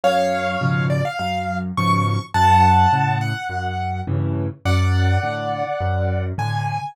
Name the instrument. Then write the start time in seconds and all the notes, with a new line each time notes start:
acoustic grand piano
0.03 F#2 C#5 F5
0.61 G#2 B2 C#3 F3
0.90 D5
1.05 F5
1.19 F#2 F5
1.77 G#2 B2 C#3 F3 C#6
2.34 F#2 F#5 A5
2.92 A2 C#3
3.21 F#5
3.49 F#2
4.07 G2 A2 C#3 E3
4.65 F#2 D5 F#5
5.23 A2 D3
5.80 F#2
6.38 A2 D3 G#5